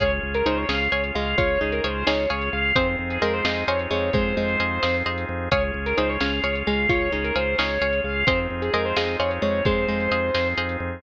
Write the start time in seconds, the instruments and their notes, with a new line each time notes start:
0.00 drawbar organ C#2 C#4 F4 G#4, pizzicato strings G#4 C#5 F5, acoustic grand piano C#5, kick, closed hi-hat
0.23 drawbar organ C#2
0.34 acoustic grand piano A#4, closed hi-hat
0.46 drawbar organ C#2, pizzicato strings D#4 G#4 C#5 F5, acoustic grand piano C5
0.57 acoustic grand piano C#5
0.69 drawbar organ C#2, pizzicato strings C#4 G#4 C#5 F5, acoustic grand piano F5, snare
0.92 drawbar organ C#2, pizzicato strings G#4 C#5 F5, acoustic grand piano C#5
1.04 closed hi-hat
1.15 drawbar organ C#2, pizzicato strings G#3, acoustic grand piano F5
1.38 drawbar organ C#2, pizzicato strings F4, acoustic grand piano C#5, kick, closed hi-hat
1.61 drawbar organ C#2, pizzicato strings D#4, acoustic grand piano G#4
1.72 acoustic grand piano A#4, closed hi-hat
1.84 drawbar organ C#2, pizzicato strings G#4 C#5 F5, acoustic grand piano C5
2.07 drawbar organ C#2, pizzicato strings D#4 G#4 C#5 F5, acoustic grand piano C#5, snare
2.30 drawbar organ C#2, pizzicato strings G#4 C#5 F5, acoustic grand piano C#5
2.41 closed hi-hat
2.53 drawbar organ C#2, acoustic grand piano F5
2.76 drawbar organ F2 C4 D#4 F4 G#4, pizzicato strings C4 G#4 C5 D#5 F5, acoustic grand piano C5, kick, closed hi-hat
2.99 drawbar organ F2
3.10 acoustic grand piano G#4, closed hi-hat
3.22 drawbar organ F2, pizzicato strings G#3 G#4 C5 D#5 F5, acoustic grand piano A#4
3.34 acoustic grand piano C5
3.44 drawbar organ F2, pizzicato strings G#3 G#4 C5 D#5 F5, acoustic grand piano D#5, snare
3.68 drawbar organ F2, pizzicato strings G#4 C5 D#5 F5, acoustic grand piano C#5
3.79 closed hi-hat
3.91 drawbar organ F2, pizzicato strings G#3, acoustic grand piano C#5
4.13 drawbar organ F2, pizzicato strings G#3, acoustic grand piano C5, kick, closed hi-hat
4.37 drawbar organ F2, pizzicato strings G#3
4.48 closed hi-hat
4.59 drawbar organ F2, pizzicato strings G#4 C5 D#5 F5
4.83 drawbar organ F2, pizzicato strings G#4 C5 D#5 F5, snare
5.06 drawbar organ F2, pizzicato strings G#4 C5 D#5 F5
5.18 closed hi-hat
5.29 drawbar organ F2
5.51 drawbar organ C#2 C#4 F4 G#4, pizzicato strings G#4 C#5 F5, acoustic grand piano C#5, kick, closed hi-hat
5.74 drawbar organ C#2
5.86 acoustic grand piano A#4, closed hi-hat
5.97 drawbar organ C#2, pizzicato strings D#4 G#4 C#5 F5, acoustic grand piano C5
6.09 acoustic grand piano C#5
6.20 drawbar organ C#2, pizzicato strings C#4 G#4 C#5 F5, acoustic grand piano F5, snare
6.43 drawbar organ C#2, pizzicato strings G#4 C#5 F5, acoustic grand piano C#5
6.55 closed hi-hat
6.67 drawbar organ C#2, pizzicato strings G#3, acoustic grand piano F5
6.89 drawbar organ C#2, pizzicato strings F4, acoustic grand piano C#5, kick, closed hi-hat
7.12 drawbar organ C#2, pizzicato strings D#4, acoustic grand piano G#4
7.24 acoustic grand piano A#4, closed hi-hat
7.36 drawbar organ C#2, pizzicato strings G#4 C#5 F5, acoustic grand piano C5
7.58 drawbar organ C#2, pizzicato strings D#4 G#4 C#5 F5, acoustic grand piano C#5, snare
7.81 drawbar organ C#2, pizzicato strings G#4 C#5 F5, acoustic grand piano C#5
7.93 closed hi-hat
8.04 drawbar organ C#2, acoustic grand piano F5
8.27 drawbar organ F2 C4 D#4 F4 G#4, pizzicato strings C4 G#4 C5 D#5 F5, acoustic grand piano C5, kick, closed hi-hat
8.50 drawbar organ F2
8.62 acoustic grand piano G#4, closed hi-hat
8.73 drawbar organ F2, pizzicato strings G#3 G#4 C5 D#5 F5, acoustic grand piano A#4
8.85 acoustic grand piano C5
8.96 drawbar organ F2, pizzicato strings G#3 G#4 C5 D#5 F5, acoustic grand piano D#5, snare
9.19 drawbar organ F2, pizzicato strings G#4 C5 D#5 F5, acoustic grand piano C#5
9.31 closed hi-hat
9.42 drawbar organ F2, pizzicato strings G#3, acoustic grand piano C#5
9.65 drawbar organ F2, pizzicato strings G#3, acoustic grand piano C5, kick, closed hi-hat
9.88 drawbar organ F2, pizzicato strings G#3
10.00 closed hi-hat
10.11 drawbar organ F2, pizzicato strings G#4 C5 D#5 F5
10.34 drawbar organ F2, pizzicato strings G#4 C5 D#5 F5, snare
10.57 drawbar organ F2, pizzicato strings G#4 C5 D#5 F5
10.69 closed hi-hat
10.80 drawbar organ F2